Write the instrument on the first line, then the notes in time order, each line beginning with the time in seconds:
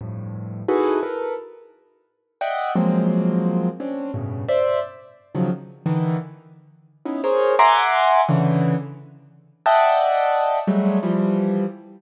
acoustic grand piano
0.01 F2 G2 A2
0.68 D#4 E4 F#4 G#4 A4 B4
1.03 A4 A#4 B4
2.41 D5 D#5 E5 F#5 G5
2.75 F3 F#3 G#3 A#3 C4
3.80 C4 C#4 D4
4.14 G2 A2 B2 C#3
4.49 C5 D5 E5
5.35 C#3 D#3 F3 F#3
5.86 D3 D#3 E3
7.05 B3 C#4 D#4 E4
7.24 G#4 A#4 C5 C#5
7.59 E5 F#5 G#5 A#5 C6 D6
8.29 C#3 D3 E3
9.66 D5 D#5 E5 F#5 G5 A5
10.67 F#3 G3 G#3 A3
11.03 E3 F3 G3